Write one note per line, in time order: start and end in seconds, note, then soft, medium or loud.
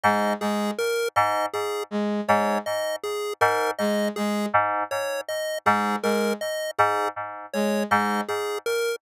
0.03 0.33 G#2 medium
0.03 0.34 G#3 medium
0.03 0.33 D#5 medium
0.40 0.70 G#3 medium
0.40 0.71 G#4 medium
0.78 1.08 A#4 medium
1.16 1.46 G#2 medium
1.16 1.46 D#5 medium
1.53 1.83 G#4 medium
1.91 2.21 G#3 medium
2.28 2.58 G#2 medium
2.28 2.58 G#3 medium
2.28 2.58 C#5 medium
2.66 2.96 D#5 medium
3.03 3.33 G#4 medium
3.41 3.71 G#2 medium
3.41 3.71 A#4 medium
3.78 4.09 G#3 medium
3.78 4.08 D#5 medium
4.16 4.46 G#3 medium
4.16 4.46 G#4 medium
4.53 4.83 G#2 medium
4.91 5.21 C#5 medium
5.28 5.58 D#5 medium
5.65 5.96 G#2 medium
5.65 5.95 G#3 medium
5.65 5.96 G#4 medium
6.03 6.33 G#3 medium
6.03 6.33 A#4 medium
6.41 6.71 D#5 medium
6.78 7.08 G#2 medium
6.78 7.08 G#4 medium
7.53 7.84 G#3 medium
7.53 7.83 C#5 medium
7.90 8.21 G#2 medium
7.90 8.20 G#3 medium
7.90 8.21 D#5 medium
8.28 8.58 G#4 medium
8.66 8.96 A#4 medium